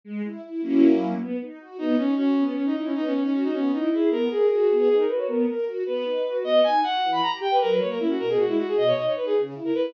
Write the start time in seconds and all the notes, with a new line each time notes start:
0.04 G#3
0.24 E4
0.44 E4
0.62 F#3 A#3 C#4 E4
1.19 B3
1.41 D#4
1.60 F#4
1.78 B3 D#4
1.98 C#4 D#4
2.17 C#4 F#4
2.37 B3
2.46 C#4
2.56 C#4
2.66 D#4
2.73 D#4 E4
2.85 C#4
2.95 B3 D#4
3.04 C#4
3.13 C#4 D#4
3.24 C#4
3.33 C#4 F#4
3.43 D#4
3.53 B3 C#4
3.72 D#4 E4
3.92 E4 G#4
4.10 B3 A#4
4.31 G#4 A#4
4.50 F#4 G#4
4.71 B3
4.79 G#4
4.89 D#4 G#4
4.99 A#4
5.08 F#4 B4
5.18 C#5
5.28 B3 A#4
5.47 A#4
5.66 F#4
5.86 B3 B4
6.04 D#4
6.26 F#4
6.43 B3 D#5
6.64 D#4 G#5
6.83 F#4 F#5
7.03 E3
7.12 B5
7.22 G4 A#5
7.41 G4 G5
7.51 B4
7.61 F#3 A#4
7.70 B4
7.80 A#3 C#5
7.90 A#4
7.99 C#4 E4
8.09 F#4
8.19 B2 A#4
8.29 G#4
8.39 G#3 F#4
8.48 E4
8.58 D#4 F#4
8.68 G#4
8.75 B2 D#5
8.87 C#5
8.97 D#4 D#5
9.06 C#5
9.16 D#4 B4
9.26 G#4
9.37 C#3
9.54 E4
9.65 A#4
9.74 E4 B4